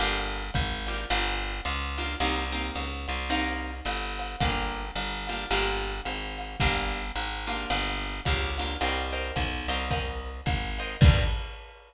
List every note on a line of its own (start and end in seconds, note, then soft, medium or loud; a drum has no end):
0.00 0.51 G1 loud
0.00 0.42 A#3 loud
0.00 0.42 D4 loud
0.00 0.42 F4 loud
0.00 0.42 G4 loud
0.00 ride medium
0.54 1.06 G#1 loud
0.54 kick medium
0.54 hi-hat pedal medium
0.54 ride medium
0.87 1.04 A#3 medium
0.87 1.04 D4 medium
0.87 1.04 F4 medium
0.87 1.04 G4 medium
0.87 ride medium
1.10 1.61 G1 loud
1.10 1.52 A#3 loud
1.10 1.52 D4 loud
1.10 1.52 F4 loud
1.10 1.52 G4 loud
1.10 ride loud
1.65 2.16 C#2 loud
1.65 hi-hat pedal medium
1.65 ride medium
1.98 2.14 A#3 medium
1.98 2.14 D4 medium
1.98 2.14 F4 loud
1.98 2.14 G4 medium
1.98 ride medium
2.20 2.71 C2 loud
2.20 2.44 A#3 loud
2.20 2.44 C4 loud
2.20 2.44 D#4 loud
2.20 2.44 G4 loud
2.20 ride loud
2.52 2.88 A#3 medium
2.52 2.88 C4 medium
2.52 2.88 D#4 medium
2.52 2.88 G4 medium
2.75 3.07 C#2 medium
2.75 hi-hat pedal medium
2.75 ride medium
3.08 3.81 C2 loud
3.08 ride medium
3.30 3.72 A#3 loud
3.30 3.72 C4 loud
3.30 3.72 D#4 loud
3.30 3.72 G4 loud
3.30 ride loud
3.85 4.36 G1 loud
3.85 hi-hat pedal medium
3.85 ride medium
4.19 ride medium
4.40 4.91 G1 loud
4.40 4.83 A#3 loud
4.40 4.83 D4 loud
4.40 4.83 F4 loud
4.40 4.83 G4 loud
4.40 kick medium
4.40 ride loud
4.96 5.46 G1 loud
4.96 hi-hat pedal medium
4.96 ride medium
5.27 5.45 A#3 loud
5.27 5.45 D4 medium
5.27 5.45 F4 medium
5.27 5.45 G4 medium
5.27 ride medium
5.51 6.01 G1 loud
5.51 5.93 A#3 loud
5.51 5.93 D4 loud
5.51 5.93 F4 loud
5.51 5.93 G4 loud
5.51 ride loud
6.05 6.56 G#1 medium
6.05 hi-hat pedal medium
6.05 ride medium
6.38 ride medium
6.60 7.12 G1 loud
6.60 7.02 A#3 loud
6.60 7.02 D4 loud
6.60 7.02 F4 loud
6.60 7.02 G4 loud
6.60 kick medium
6.60 ride medium
7.15 7.66 G#1 loud
7.15 hi-hat pedal medium
7.15 ride medium
7.47 8.11 A#3 loud
7.47 8.11 D4 loud
7.47 8.11 F4 loud
7.47 8.11 G4 loud
7.47 ride medium
7.70 8.21 G1 loud
7.70 ride loud
8.25 8.77 C#2 loud
8.25 8.50 A#3 medium
8.25 8.50 D4 medium
8.25 8.50 F4 medium
8.25 8.50 G4 medium
8.25 kick medium
8.25 hi-hat pedal medium
8.25 ride medium
8.58 8.75 A#3 medium
8.58 8.75 D4 medium
8.58 8.75 F4 medium
8.58 8.75 G4 medium
8.58 ride medium
8.81 9.32 C2 loud
8.81 9.04 A#4 loud
8.81 9.04 C5 loud
8.81 9.04 D#5 medium
8.81 9.04 G5 loud
8.81 ride loud
9.13 9.48 A#4 medium
9.13 9.48 C5 medium
9.13 9.48 D#5 medium
9.13 9.48 G5 medium
9.36 9.67 B1 medium
9.36 kick medium
9.36 hi-hat pedal medium
9.36 ride medium
9.68 10.41 C2 loud
9.68 9.85 A#4 medium
9.68 9.85 C5 loud
9.68 9.85 D#5 medium
9.68 9.85 G5 medium
9.68 ride medium
9.90 10.32 A#4 loud
9.90 10.32 C5 loud
9.90 10.32 D#5 loud
9.90 10.32 G5 loud
9.90 kick medium
9.90 ride medium
10.46 10.97 G#1 medium
10.46 kick medium
10.46 hi-hat pedal medium
10.46 ride medium
10.79 10.95 A#4 medium
10.79 10.95 C5 medium
10.79 10.95 D#5 medium
10.79 10.95 G5 medium
10.79 ride medium
11.01 11.24 G2 loud
11.01 11.24 A#3 loud
11.01 11.24 D4 loud
11.01 11.24 F4 loud
11.01 11.24 G4 medium
11.01 kick loud
11.01 crash loud